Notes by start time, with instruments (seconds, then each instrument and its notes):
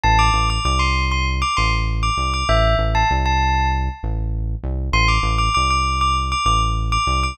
0.03 synth bass 1 A1, tubular bells A5
0.19 tubular bells D6
0.33 synth bass 1 A1
0.50 tubular bells D6
0.65 synth bass 1 C2, tubular bells D6
0.79 tubular bells C6
1.11 tubular bells C6
1.42 tubular bells D6
1.57 synth bass 1 A1, tubular bells C6
2.03 tubular bells D6
2.17 synth bass 1 C2
2.34 tubular bells D6
2.49 synth bass 1 A1, tubular bells E5
2.78 synth bass 1 A1
2.95 tubular bells A5
3.11 synth bass 1 C2
3.26 tubular bells A5
4.03 synth bass 1 A1
4.63 synth bass 1 C2
4.92 synth bass 1 A1, tubular bells C6
5.08 tubular bells D6
5.23 synth bass 1 A1
5.38 tubular bells D6
5.54 synth bass 1 C2, tubular bells D6
5.70 tubular bells D6
6.01 tubular bells D6
6.32 tubular bells D6
6.45 synth bass 1 A1, tubular bells D6
6.92 tubular bells D6
7.07 synth bass 1 C2
7.23 tubular bells D6